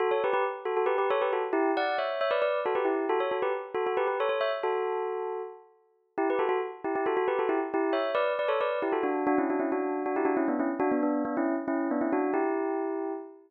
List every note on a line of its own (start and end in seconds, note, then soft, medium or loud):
0.00 0.10 F#4 medium
0.00 0.10 A4 medium
0.11 0.22 A4 medium
0.11 0.22 C#5 medium
0.24 0.33 G4 medium
0.24 0.33 B4 medium
0.33 0.44 G4 medium
0.33 0.44 B4 medium
0.65 0.76 F#4 medium
0.65 0.76 A4 medium
0.77 0.87 F#4 medium
0.77 0.87 A4 medium
0.86 0.97 G4 medium
0.86 0.97 B4 medium
0.98 1.09 G4 medium
0.98 1.09 B4 medium
1.10 1.21 A4 medium
1.10 1.21 C#5 medium
1.22 1.32 G4 medium
1.22 1.32 B4 medium
1.33 1.43 F#4 medium
1.33 1.43 A4 medium
1.53 1.71 E4 medium
1.53 1.71 G4 medium
1.77 1.97 D5 medium
1.77 1.97 F#5 medium
1.98 2.19 C#5 medium
1.98 2.19 E5 medium
2.21 2.31 C#5 medium
2.21 2.31 E5 medium
2.31 2.41 B4 medium
2.31 2.41 D5 medium
2.42 2.60 B4 medium
2.42 2.60 D5 medium
2.66 2.76 F#4 medium
2.66 2.76 A4 medium
2.75 2.84 G4 medium
2.75 2.86 B4 medium
2.85 3.05 E4 medium
2.85 3.05 G4 medium
3.09 3.20 F#4 medium
3.09 3.20 A4 medium
3.20 3.31 A4 medium
3.20 3.31 C#5 medium
3.31 3.42 F#4 medium
3.31 3.42 A4 medium
3.42 3.53 G4 medium
3.42 3.53 B4 medium
3.75 3.85 F#4 medium
3.75 3.85 A4 medium
3.86 3.97 F#4 medium
3.86 3.97 A4 medium
3.97 4.07 G4 medium
3.97 4.07 B4 medium
4.07 4.18 G4 medium
4.07 4.18 B4 medium
4.20 4.29 A4 medium
4.20 4.29 C#5 medium
4.29 4.40 A4 medium
4.29 4.40 C#5 medium
4.41 4.51 C#5 medium
4.41 4.51 E5 medium
4.63 5.42 F#4 medium
4.63 5.42 A4 medium
6.18 6.28 E4 medium
6.18 6.28 G4 medium
6.30 6.40 G4 medium
6.30 6.40 B4 medium
6.39 6.48 F#4 medium
6.39 6.48 A4 medium
6.49 6.59 F#4 medium
6.49 6.59 A4 medium
6.84 6.95 E4 medium
6.84 6.95 G4 medium
6.95 7.06 E4 medium
6.95 7.06 G4 medium
7.06 7.16 F#4 medium
7.06 7.16 A4 medium
7.17 7.27 F#4 medium
7.17 7.27 A4 medium
7.28 7.38 G4 medium
7.28 7.38 B4 medium
7.39 7.49 F#4 medium
7.39 7.49 A4 medium
7.49 7.59 E4 medium
7.49 7.59 G4 medium
7.74 7.93 E4 medium
7.74 7.93 G4 medium
7.93 8.11 C#5 medium
7.93 8.11 E5 medium
8.15 8.33 B4 medium
8.15 8.33 D5 medium
8.39 8.49 B4 medium
8.39 8.49 D5 medium
8.48 8.59 A4 medium
8.48 8.59 C#5 medium
8.61 8.79 B4 medium
8.61 8.79 D5 medium
8.82 8.93 E4 medium
8.82 8.93 G4 medium
8.92 9.03 F#4 medium
8.92 9.03 A4 medium
9.03 9.24 D4 medium
9.03 9.24 F#4 medium
9.27 9.37 D4 medium
9.27 9.37 F#4 medium
9.38 9.49 C#4 medium
9.38 9.49 E4 medium
9.50 9.60 D4 medium
9.50 9.60 F#4 medium
9.60 9.70 C#4 medium
9.60 9.70 E4 medium
9.72 10.03 D4 medium
9.72 10.03 F#4 medium
10.06 10.16 D4 medium
10.06 10.16 F#4 medium
10.16 10.27 E4 medium
10.16 10.27 G4 medium
10.25 10.36 D4 medium
10.25 10.36 F#4 medium
10.37 10.47 C#4 medium
10.37 10.47 E4 medium
10.48 10.59 B3 medium
10.48 10.59 D4 medium
10.59 10.70 C#4 medium
10.59 10.70 E4 medium
10.80 10.90 D4 medium
10.80 10.90 F#4 medium
10.92 11.02 B3 medium
10.92 11.02 D4 medium
11.03 11.23 B3 medium
11.03 11.23 D4 medium
11.25 11.35 B3 medium
11.25 11.35 D4 medium
11.37 11.55 C#4 medium
11.37 11.55 E4 medium
11.68 11.88 C#4 medium
11.68 11.88 E4 medium
11.91 12.01 B3 medium
11.91 12.01 D4 medium
12.01 12.12 C#4 medium
12.01 12.12 E4 medium
12.12 12.31 D4 medium
12.12 12.31 F#4 medium
12.34 13.13 E4 medium
12.34 13.13 G4 medium